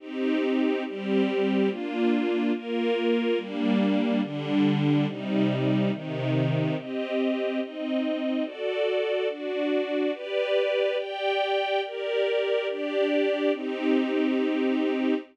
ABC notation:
X:1
M:2/4
L:1/8
Q:1/4=71
K:Cm
V:1 name="String Ensemble 1"
[CEG]2 [G,CG]2 | [B,DF]2 [B,FB]2 | [G,B,D]2 [D,G,D]2 | [C,G,E]2 [C,E,E]2 |
[CGe]2 [CEe]2 | [^F=Ad]2 [DFd]2 | [G=Bd]2 [Gdg]2 | [GBd]2 [DGd]2 |
[CEG]4 |]